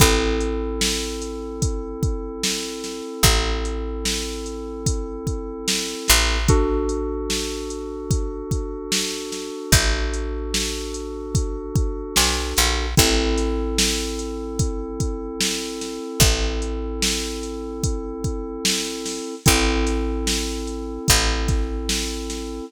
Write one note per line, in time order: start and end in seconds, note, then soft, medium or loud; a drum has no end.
0.00 3.01 A1 loud
0.00 6.37 C4 medium
0.00 6.37 E4 medium
0.00 6.37 A4 medium
0.00 kick loud
0.00 closed hi-hat loud
0.41 closed hi-hat medium
0.81 snare loud
1.22 closed hi-hat medium
1.62 kick loud
1.62 closed hi-hat loud
2.03 kick loud
2.03 closed hi-hat medium
2.43 snare loud
2.84 snare medium
2.84 closed hi-hat medium
3.23 5.94 A1 loud
3.23 kick loud
3.23 closed hi-hat loud
3.65 closed hi-hat medium
4.05 snare loud
4.46 closed hi-hat medium
4.86 kick loud
4.86 closed hi-hat loud
5.27 kick medium
5.27 closed hi-hat medium
5.68 snare loud
6.08 9.50 A1 loud
6.08 snare medium
6.08 closed hi-hat loud
6.48 12.86 D4 medium
6.48 12.86 F#4 medium
6.48 12.86 A4 medium
6.48 kick loud
6.48 closed hi-hat loud
6.89 closed hi-hat medium
7.30 snare loud
7.70 closed hi-hat medium
8.11 kick loud
8.11 closed hi-hat loud
8.51 kick loud
8.51 closed hi-hat medium
8.92 snare loud
9.32 snare medium
9.32 closed hi-hat medium
9.72 12.05 A1 medium
9.72 kick loud
9.72 closed hi-hat loud
10.14 closed hi-hat medium
10.54 snare loud
10.94 closed hi-hat medium
11.35 kick loud
11.35 closed hi-hat loud
11.76 kick loud
11.76 closed hi-hat medium
12.16 12.54 B1 medium
12.16 snare loud
12.57 12.95 A#1 medium
12.57 snare medium
12.57 closed hi-hat medium
12.97 15.99 A1 loud
12.97 19.35 C4 medium
12.97 19.35 E4 medium
12.97 19.35 A4 medium
12.97 kick loud
12.97 closed hi-hat loud
13.38 snare soft
13.38 closed hi-hat loud
13.78 snare loud
14.19 closed hi-hat medium
14.59 kick loud
14.59 closed hi-hat loud
15.00 kick loud
15.00 closed hi-hat loud
15.41 snare loud
15.81 snare medium
15.81 closed hi-hat medium
16.20 19.20 A1 medium
16.20 kick loud
16.20 closed hi-hat loud
16.62 closed hi-hat medium
17.02 snare loud
17.43 closed hi-hat medium
17.83 kick loud
17.83 closed hi-hat loud
18.24 kick medium
18.24 closed hi-hat medium
18.65 snare loud
19.06 snare medium
19.06 open hi-hat medium
19.46 20.98 A1 loud
19.46 22.65 C4 medium
19.46 22.65 E4 medium
19.46 22.65 A4 medium
19.46 kick loud
19.46 closed hi-hat loud
19.86 snare soft
19.86 closed hi-hat loud
20.27 snare loud
20.67 closed hi-hat medium
21.08 22.60 A1 loud
21.08 kick loud
21.08 closed hi-hat loud
21.48 kick loud
21.48 snare soft
21.48 closed hi-hat medium
21.89 snare loud
22.30 snare medium
22.30 closed hi-hat medium